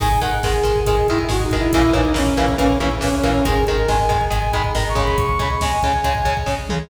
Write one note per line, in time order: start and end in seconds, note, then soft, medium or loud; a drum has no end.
0.00 0.20 G#1 loud
0.00 0.08 D#3 loud
0.00 0.08 G#3 loud
0.00 0.20 G#5 loud
0.00 kick loud
0.00 crash loud
0.11 kick loud
0.20 0.39 G#1 medium
0.20 0.30 D#3 medium
0.20 0.30 G#3 medium
0.20 0.38 F#5 medium
0.20 kick loud
0.20 closed hi-hat medium
0.32 kick medium
0.43 0.62 G#1 medium
0.43 0.53 D#3 medium
0.43 0.53 G#3 medium
0.43 0.80 G#4 medium
0.43 kick loud
0.43 snare loud
0.54 kick loud
0.63 0.82 G#1 medium
0.63 0.72 D#3 medium
0.63 0.72 G#3 medium
0.63 kick loud
0.63 closed hi-hat loud
0.76 kick loud
0.86 1.04 G#1 medium
0.86 0.96 D#3 medium
0.86 0.96 G#3 medium
0.86 1.07 G#4 medium
0.86 kick loud
0.86 closed hi-hat loud
0.97 kick loud
1.08 1.26 G#1 medium
1.08 1.18 D#3 medium
1.08 1.18 G#3 medium
1.08 1.18 E4 medium
1.08 kick loud
1.08 closed hi-hat medium
1.19 kick loud
1.29 1.48 G#1 loud
1.29 1.37 D#3 medium
1.29 1.37 G#3 medium
1.29 1.44 F#4 medium
1.29 kick loud
1.29 snare loud
1.40 1.57 D#4 medium
1.40 kick loud
1.50 1.68 G#1 medium
1.50 1.61 D#3 medium
1.50 1.61 G#3 medium
1.50 kick loud
1.50 closed hi-hat medium
1.58 1.72 E4 medium
1.58 kick medium
1.72 1.90 A#1 loud
1.72 1.83 C#3 loud
1.72 1.83 E3 medium
1.72 1.83 A#3 loud
1.72 1.92 E4 medium
1.72 kick loud
1.72 closed hi-hat loud
1.83 kick loud
1.93 2.13 A#1 loud
1.93 2.02 C#3 medium
1.93 2.02 E3 medium
1.93 2.02 A#3 medium
1.93 2.13 D#4 medium
1.93 kick loud
1.93 closed hi-hat medium
2.05 kick loud
2.14 2.33 A#1 medium
2.14 2.23 C#3 medium
2.14 2.23 E3 medium
2.14 2.23 A#3 medium
2.14 2.55 C#4 medium
2.14 kick loud
2.14 snare loud
2.27 kick loud
2.37 2.55 A#1 medium
2.37 2.46 C#3 medium
2.37 2.46 E3 medium
2.37 2.46 A#3 loud
2.37 kick medium
2.37 closed hi-hat medium
2.48 kick loud
2.58 2.77 A#1 loud
2.58 2.67 C#3 medium
2.58 2.67 E3 medium
2.58 2.67 A#3 medium
2.58 2.78 C#4 medium
2.58 kick loud
2.58 closed hi-hat loud
2.70 kick loud
2.80 2.98 A#1 medium
2.80 2.89 C#3 medium
2.80 2.89 E3 medium
2.80 2.89 A#3 medium
2.80 2.90 C#4 medium
2.80 kick medium
2.80 closed hi-hat medium
2.91 kick medium
3.01 3.21 A#1 medium
3.01 3.09 C#3 medium
3.01 3.09 E3 medium
3.01 3.09 A#3 medium
3.01 3.15 C#4 medium
3.01 kick loud
3.01 snare loud
3.13 3.30 C#4 medium
3.13 kick loud
3.23 3.42 A#1 medium
3.23 3.32 C#3 medium
3.23 3.32 E3 medium
3.23 3.32 A#3 medium
3.23 kick medium
3.23 closed hi-hat medium
3.31 3.45 C#4 medium
3.31 kick medium
3.45 3.64 G#1 loud
3.45 3.54 D#3 loud
3.45 3.54 G#3 loud
3.45 3.65 G#4 medium
3.45 kick loud
3.45 closed hi-hat loud
3.56 kick loud
3.67 3.86 G#1 medium
3.67 3.77 D#3 medium
3.67 3.77 G#3 medium
3.67 3.89 A#4 medium
3.67 kick medium
3.67 closed hi-hat medium
3.78 kick loud
3.88 4.07 G#1 medium
3.88 3.97 D#3 medium
3.88 3.97 G#3 medium
3.88 4.24 G#5 medium
3.88 kick loud
3.88 snare loud
3.99 kick loud
4.09 4.30 G#1 medium
4.09 4.18 D#3 medium
4.09 4.18 G#3 medium
4.09 kick loud
4.09 closed hi-hat medium
4.21 kick loud
4.30 4.50 G#1 loud
4.30 4.39 D#3 medium
4.30 4.39 G#3 medium
4.30 4.52 G#5 medium
4.30 kick loud
4.30 closed hi-hat loud
4.42 kick medium
4.53 4.71 G#1 medium
4.53 4.62 D#3 medium
4.53 4.62 G#3 loud
4.53 4.63 B5 medium
4.53 kick loud
4.53 closed hi-hat medium
4.64 kick loud
4.74 4.93 G#1 loud
4.74 4.83 D#3 medium
4.74 4.83 G#3 medium
4.74 4.88 A#5 medium
4.74 kick loud
4.74 snare loud
4.86 5.03 C#6 medium
4.86 kick medium
4.95 5.15 G#1 medium
4.95 5.26 C#3 loud
4.95 5.26 G#3 medium
4.95 kick loud
4.95 closed hi-hat medium
5.04 5.17 B5 medium
5.04 kick loud
5.18 5.36 C#2 loud
5.18 5.39 C#6 loud
5.18 kick loud
5.18 closed hi-hat loud
5.29 kick loud
5.39 5.57 C#2 loud
5.39 5.48 C#3 medium
5.39 5.48 G#3 medium
5.39 5.50 B5 medium
5.39 kick loud
5.39 closed hi-hat medium
5.50 5.61 C#6 medium
5.50 kick loud
5.60 5.79 C#2 medium
5.60 5.71 C#3 medium
5.60 5.71 G#3 medium
5.60 6.37 G#5 medium
5.60 kick loud
5.60 snare loud
5.72 kick medium
5.83 6.01 C#2 loud
5.83 5.92 C#3 medium
5.83 5.92 G#3 medium
5.83 kick loud
5.83 closed hi-hat medium
5.94 kick medium
6.04 6.22 C#2 medium
6.04 6.13 C#3 medium
6.04 6.13 G#3 medium
6.04 kick medium
6.04 closed hi-hat loud
6.15 kick loud
6.24 6.43 C#2 medium
6.24 6.34 C#3 medium
6.24 6.34 G#3 medium
6.24 kick loud
6.24 closed hi-hat medium
6.37 kick loud
6.46 6.66 C#2 medium
6.46 6.55 C#3 medium
6.46 6.55 G#3 medium
6.46 kick loud
6.46 snare loud
6.69 6.88 C#2 medium
6.69 6.79 C#3 medium
6.69 6.79 G#3 medium
6.69 mid tom loud